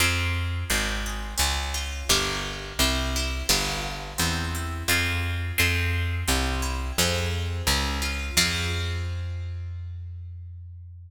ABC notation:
X:1
M:4/4
L:1/8
Q:1/4=86
K:Fm
V:1 name="Acoustic Guitar (steel)"
[CFA]2 C A D F [=DGB]2 | C =E [=B,=DFG]2 C E [CFA]2 | [CFA]2 C =E [CFA]2 D F | [CFA]8 |]
V:2 name="Electric Bass (finger)" clef=bass
F,,2 A,,,2 D,,2 G,,,2 | C,,2 G,,,2 =E,,2 F,,2 | F,,2 C,,2 F,,2 D,,2 | F,,8 |]